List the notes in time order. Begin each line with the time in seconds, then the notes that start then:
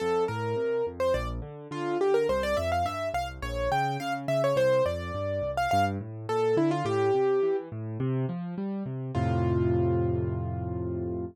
0.00 F2 A4
0.28 A2 A#4
0.56 C3
0.86 F2
1.00 C5
1.14 A#1 D5
1.42 D3
1.71 D3 F4
2.01 D3 G4
2.14 A#4
2.29 C2 C5
2.43 D5
2.57 F2 E5
2.72 F5
2.85 G2 E5
3.14 C2 F5
3.42 A#1 C#5
3.72 C#3 G5
4.00 C#3 F5
4.28 C#3 E5
4.44 C#5
4.56 C2 C5
4.86 F2 D5
5.14 G2
5.42 C2
5.57 F5
5.71 G2 F5
6.01 A2
6.29 A#2 A4
6.57 D3 E4
6.71 F4
6.85 A2 G4
7.14 C3
7.43 E3
7.72 A2
8.00 C3
8.29 F3
8.58 G3
8.86 C3
9.15 F2 A2 C3 F4